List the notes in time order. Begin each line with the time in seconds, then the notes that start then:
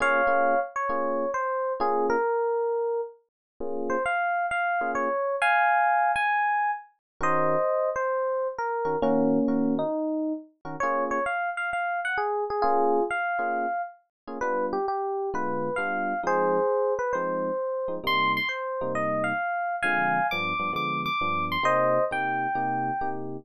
0.00 A#3 C#4 F4 G#4 C#5 F5
0.27 A#3 C#4 F4 G#4
0.76 C#5
0.89 A#3 C#4 F4 G#4
1.34 C5
1.80 A#3 C#4 F4 G#4
2.10 A#4
3.60 A#3 C#4 F4 G#4
3.90 C5
4.06 F5
4.51 F5
4.81 A#3 C#4 F4 G#4
4.95 C#5
5.42 F5 G#5
6.16 G#5
7.21 D#3 C#4 F#4 A#4 C5 D#5
7.96 C5
8.58 A#4
8.85 D#3 C#4 F#4 A#4
9.02 D#3 A#3 C#4 F#4 A#4
9.48 D#3 C#4 F#4 A#4
9.79 D#4
10.65 D#3 C#4 F#4 A#4
10.80 A#3 C#4 F4 G#4 C#5
11.11 C#5
11.26 F5
11.57 F5
11.73 F5
12.05 F#5
12.18 G#4
12.50 G#4
12.62 A#3 C#4 F4 G#4
13.11 F5
13.39 A#3 C#4 F4 G#4
14.27 A#3 C#4 F4 G#4
14.41 G3 B3 D4 F4 B4
14.73 G4
14.88 G4
15.34 D3 G#3 B3 F4 B4
15.76 G3 B3 D4 F4 F5
16.23 F3 G#3 C4 D#4 G#4 C5
16.99 B4
17.13 F3 G#3 C4 D#4 C5
17.88 F3 G#3 C4 D#4
18.04 C3 G3 A#3 D#4 C6
18.37 C6
18.49 C5
18.81 C3 G3 A#3 D#4
18.95 D#5
19.24 F5
19.83 D3 F3 G#3 C4 F5 G#5
20.31 G2 F3 B3 D4 D6
20.59 G2 F3 B3 D4
20.73 D3 F3 G#3 B3 D6
21.06 D6
21.21 G2 F3 B3 D4
21.52 C6
21.63 C3 A#3 D#4 G4 C5 D#5
22.11 C3 A#3 D#4 G4 G5
22.55 C3 A#3 D#4 G4
23.01 C3 A#3 D#4 G4